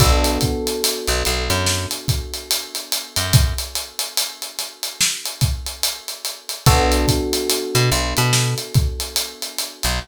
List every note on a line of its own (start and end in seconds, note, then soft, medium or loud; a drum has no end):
0.00 0.38 B1 loud
0.00 6.56 B3 loud
0.00 6.56 D4 medium
0.00 6.56 F#4 loud
0.00 6.56 A4 loud
0.00 kick loud
0.00 closed hi-hat loud
0.24 closed hi-hat medium
0.41 kick medium
0.41 closed hi-hat medium
0.67 closed hi-hat medium
0.84 closed hi-hat loud
1.07 1.23 B1 medium
1.07 closed hi-hat medium
1.25 1.49 B1 medium
1.25 closed hi-hat medium
1.49 1.86 F#2 medium
1.49 snare soft
1.49 closed hi-hat medium
1.66 snare medium
1.91 closed hi-hat medium
2.08 kick medium
2.08 closed hi-hat medium
2.34 closed hi-hat medium
2.51 closed hi-hat loud
2.75 closed hi-hat medium
2.92 closed hi-hat medium
3.16 3.54 F#2 medium
3.16 closed hi-hat medium
3.33 kick loud
3.33 closed hi-hat medium
3.58 closed hi-hat medium
3.75 closed hi-hat medium
3.99 closed hi-hat medium
4.17 closed hi-hat loud
4.42 closed hi-hat medium
4.59 snare soft
4.59 closed hi-hat medium
4.83 closed hi-hat medium
5.01 snare loud
5.26 closed hi-hat medium
5.41 kick medium
5.41 closed hi-hat medium
5.66 closed hi-hat medium
5.83 closed hi-hat loud
6.08 closed hi-hat medium
6.25 closed hi-hat medium
6.49 closed hi-hat medium
6.66 7.06 B1 loud
6.66 9.95 B3 loud
6.66 9.95 D4 loud
6.66 9.95 F#4 loud
6.66 9.95 A4 loud
6.66 kick loud
6.66 closed hi-hat medium
6.92 closed hi-hat medium
7.08 kick medium
7.08 closed hi-hat medium
7.33 closed hi-hat medium
7.50 closed hi-hat medium
7.75 7.90 B2 loud
7.75 closed hi-hat medium
7.91 8.14 B1 medium
7.91 closed hi-hat medium
8.17 8.55 B2 loud
8.17 closed hi-hat medium
8.33 snare loud
8.58 closed hi-hat medium
8.74 kick medium
8.74 closed hi-hat medium
9.00 closed hi-hat medium
9.16 closed hi-hat medium
9.42 closed hi-hat medium
9.59 closed hi-hat medium
9.83 9.99 B1 medium
9.83 closed hi-hat medium